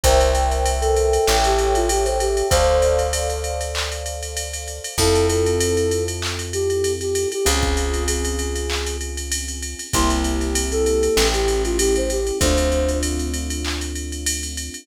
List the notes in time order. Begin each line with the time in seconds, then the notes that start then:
0.03 C2 A#4 C5 E5 G5, kick, ride
0.20 ride
0.35 ride
0.51 ride
0.66 ride
0.81 A4, ride
0.97 ride
1.13 ride
1.27 A1 A4 C#5 E5 G5, snare
1.44 G4, ride
1.58 ride
1.75 F4, ride
1.89 G4, ride
2.05 C5, ride
2.20 G4, ride
2.37 ride
2.50 D2 A4 C5 D5 F5, kick, ride
2.82 ride
2.99 ride
3.13 ride
3.30 ride
3.44 ride
3.61 ride
3.75 clap
3.92 ride
4.06 ride
4.23 ride
4.37 ride
4.53 ride
4.68 ride
4.84 ride
4.98 F2 C4 E4 F4 A4, kick, crash
5.15 ride
5.29 A4, ride
5.46 ride
5.60 ride
5.77 ride
5.91 ride
6.08 ride
6.22 clap
6.39 ride
6.53 G4, ride
6.70 ride
6.84 ride
7.01 G4, ride
7.15 ride
7.32 G4, ride
7.45 C#2 C4 C#4 F4 G#4, ride
7.63 kick, ride
7.77 ride
7.94 ride
8.08 G#4, ride
8.25 ride
8.39 ride
8.56 ride
8.70 clap
8.86 ride
9.01 ride
9.17 ride
9.32 ride
9.48 ride
9.63 ride
9.79 ride
9.93 C2 A#3 C4 E4 G4 C6, kick, ride
10.10 snare, ride
10.24 ride
10.41 snare, ride
10.55 ride
10.72 A4, ride
10.86 ride
11.03 ride
11.16 A1 A3 C#4 E4 G4, snare
11.33 G4, ride
11.48 ride
11.65 F4, ride
11.79 G4, ride
11.96 C5, ride
12.10 G4, ride
12.27 ride
12.40 D2 A3 C4 D4 F4 C5, kick, ride
12.58 ride
12.72 ride
12.89 ride
13.03 ride
13.19 ride
13.34 ride
13.50 ride
13.65 clap
13.81 ride
13.95 ride
14.12 ride
14.26 ride
14.43 ride
14.57 ride
14.74 ride